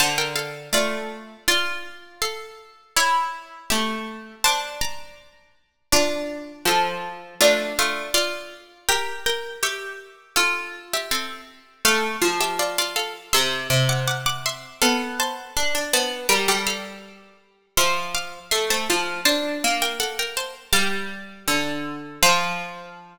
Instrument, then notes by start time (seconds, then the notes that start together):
harpsichord
0.00 D3 C5 A5
0.18 A#4 G5
0.36 A4 F5
0.73 A3 F4 D5
1.48 F4 D5
2.22 A4 F5
2.96 E4 C#5
3.70 A3 G4 E5
4.44 D4 C5 A5
4.81 D5 A#5
5.92 D4 F4 D5
6.65 F3 A4 F5
7.41 A3 D4 F4
7.79 A3 F4
8.14 F4 D5
8.89 G4 A#4 G5
9.26 A#4 G5
9.63 G4 E5 C#6
10.36 F4 A4 F5
10.93 G4 E5
11.11 C4 A4
11.85 A3 A4 F5
12.22 F3
12.41 G4 E5
12.59 F4 D5
12.78 F4 D5
12.96 A4 F5
13.33 C3 E5 C6
13.70 C3
13.89 F#5 D6
14.08 F#5 D6
14.26 F#5 D6
14.46 E5 C6
14.82 B3 A4 F5
15.20 C5 A5
15.57 D4
15.75 D4
15.93 B3 C5 A5
16.29 G3 A#4 G5
16.48 G3 A4 F5
16.67 A4 F5
17.77 F3 E5 C6
18.15 F5 D6
18.51 A3 E5 C6
18.70 A3 C5 A5
18.90 F3 C5 A5
19.25 D4 C5 A5
19.64 A#3
19.82 A#4 G5
20.00 A4 F#5
20.19 A#4 G5
20.37 C5 A5
20.73 G3 F5 D6
21.48 D3
22.23 F3 F5